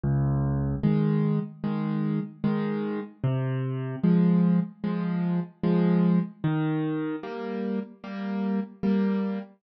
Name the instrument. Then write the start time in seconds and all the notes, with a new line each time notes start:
acoustic grand piano
0.04 C#2
0.83 D#3 G#3
1.64 D#3 G#3
2.44 D#3 G#3
3.24 C3
4.04 F3 G#3
4.84 F3 G#3
5.64 F3 G#3
6.44 D#3
7.23 G3 A#3
8.04 G3 A#3
8.83 G3 A#3